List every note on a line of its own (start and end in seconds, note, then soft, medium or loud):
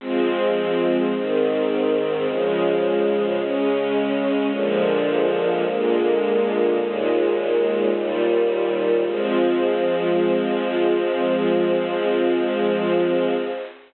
0.00 1.12 F3 medium
0.00 1.12 G#3 medium
0.00 1.12 C4 loud
1.14 2.26 G#2 medium
1.14 2.26 D#3 medium
1.14 2.26 C4 medium
2.26 3.38 C#3 medium
2.26 3.38 F3 medium
2.26 3.38 G#3 medium
3.39 4.51 C#3 medium
3.39 4.51 G#3 medium
3.39 4.51 C#4 medium
4.52 5.64 A#2 medium
4.52 5.64 D3 medium
4.52 5.64 F3 loud
4.52 5.64 G#3 medium
5.67 6.78 A#2 medium
5.67 6.79 D3 medium
5.67 6.78 G#3 medium
5.67 6.79 A#3 medium
6.79 7.91 D#2 medium
6.79 7.91 A#2 medium
6.79 7.91 G#3 medium
7.92 9.04 D#2 medium
7.92 9.04 A#2 medium
7.92 9.04 G3 medium
9.05 13.35 F3 loud
9.05 13.35 G#3 loud
9.05 13.35 C4 medium